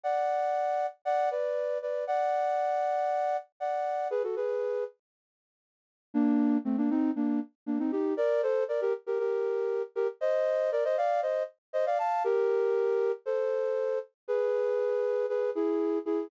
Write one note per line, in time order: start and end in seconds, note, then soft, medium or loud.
0.03 0.86 D5 medium
0.03 0.86 F#5 medium
1.05 1.29 D5 medium
1.05 1.29 F#5 medium
1.31 1.78 B4 medium
1.31 1.78 D5 medium
1.82 2.05 B4 medium
1.82 2.05 D5 medium
2.07 3.37 D5 medium
2.07 3.37 F#5 medium
3.60 4.08 D5 medium
3.60 4.08 F#5 medium
4.10 4.22 G#4 medium
4.10 4.22 B4 medium
4.23 4.35 F#4 medium
4.23 4.35 A4 medium
4.36 4.84 G#4 medium
4.36 4.84 B4 medium
6.14 6.58 A#3 medium
6.14 6.58 D4 loud
6.65 6.77 A3 medium
6.65 6.77 C4 medium
6.78 6.90 A#3 medium
6.78 6.90 D4 medium
6.90 7.11 C4 medium
6.90 7.11 D#4 medium
7.16 7.40 A#3 medium
7.16 7.40 D4 medium
7.66 7.78 A#3 medium
7.66 7.78 D4 medium
7.79 7.91 C4 medium
7.79 7.91 D#4 medium
7.92 8.14 D#4 medium
7.92 8.14 G4 medium
8.17 8.42 A#4 medium
8.17 8.42 D5 medium
8.43 8.64 A4 medium
8.43 8.64 C5 medium
8.68 8.81 A#4 medium
8.68 8.81 D5 medium
8.81 8.93 G4 medium
8.81 8.93 A#4 medium
9.07 9.19 G4 medium
9.07 9.19 A#4 medium
9.19 9.82 G4 medium
9.19 9.82 A#4 medium
9.95 10.08 G4 medium
9.95 10.08 A#4 medium
10.21 10.70 C5 medium
10.21 10.70 D#5 medium
10.72 10.84 A#4 medium
10.72 10.84 D5 medium
10.84 10.97 C5 medium
10.84 10.97 D#5 medium
10.97 11.21 D5 medium
10.97 11.21 F5 medium
11.22 11.43 C5 medium
11.22 11.43 D#5 medium
11.73 11.85 C5 medium
11.73 11.85 D#5 medium
11.86 11.98 D5 medium
11.86 11.98 F5 medium
11.99 12.23 F5 medium
11.99 12.23 A5 medium
12.24 13.12 G4 medium
12.24 13.12 A#4 medium
13.26 13.99 A4 medium
13.26 13.99 C5 medium
14.28 15.26 G#4 medium
14.28 15.26 B4 medium
15.29 15.50 G#4 medium
15.29 15.50 B4 medium
15.55 15.99 E4 medium
15.55 15.99 G#4 medium
16.06 16.28 E4 medium
16.06 16.28 G#4 medium